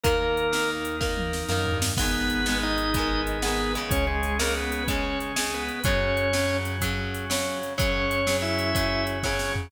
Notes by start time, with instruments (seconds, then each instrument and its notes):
0.03 synth bass 1 D#2, overdriven guitar D#3 A#3, drawbar organ A#3 D#4 A#4, kick, closed hi-hat
0.37 closed hi-hat
0.52 overdriven guitar D#3 A#3, snare
0.85 closed hi-hat
1.01 overdriven guitar D#3 A#3, kick, snare
1.17 high tom
1.33 snare
1.49 synth bass 1 F#2, overdriven guitar D#3 A#3, snare
1.67 floor tom
1.72 synth bass 1 G2
1.82 snare
1.97 synth bass 1 G#1, overdriven guitar G#3 B3, drawbar organ B3 D#4 G#4 B4, kick, crash
2.01 overdriven guitar D#3
2.30 closed hi-hat
2.46 overdriven guitar G#3 B3, snare
2.50 overdriven guitar D#3
2.63 drawbar organ D#4 D#5
2.78 closed hi-hat
2.94 overdriven guitar G#3 B3, kick, closed hi-hat
2.98 overdriven guitar D#3
3.27 closed hi-hat
3.42 overdriven guitar G#3 B3, drawbar organ B3 B4, snare
3.46 overdriven guitar D#3
3.75 overdriven guitar C#3 G#3, closed hi-hat
3.89 synth bass 1 C#2, drawbar organ C#4 G#4 C#5, kick, closed hi-hat
4.07 drawbar organ G#3 G#4
4.23 closed hi-hat
4.39 overdriven guitar C#3 G#3, drawbar organ A#3 A#4, snare
4.57 drawbar organ B3 B4
4.72 closed hi-hat
4.88 overdriven guitar C#3 G#3, drawbar organ C#4 C#5, kick, closed hi-hat
5.20 closed hi-hat
5.36 overdriven guitar C#3 G#3, snare
5.54 drawbar organ B3 B4
5.69 closed hi-hat
5.84 synth bass 1 F#2, overdriven guitar C#3 F#3, drawbar organ C#4 F#4 C#5, kick, closed hi-hat
6.17 closed hi-hat
6.33 overdriven guitar C#3 F#3, snare
6.65 closed hi-hat
6.81 overdriven guitar C#3 F#3, kick, closed hi-hat
7.14 closed hi-hat
7.30 overdriven guitar C#3 F#3, snare
7.63 closed hi-hat
7.78 synth bass 1 F#2, overdriven guitar C#3 F#3, drawbar organ C#4 F#4 C#5, kick, closed hi-hat
8.11 closed hi-hat
8.27 overdriven guitar C#3 F#3, snare
8.42 drawbar organ E4 E5
8.59 closed hi-hat
8.75 overdriven guitar C#3 F#3, kick, closed hi-hat
9.07 closed hi-hat
9.23 overdriven guitar C#3 F#3, drawbar organ C#4 C#5, kick, snare
9.39 snare
9.56 floor tom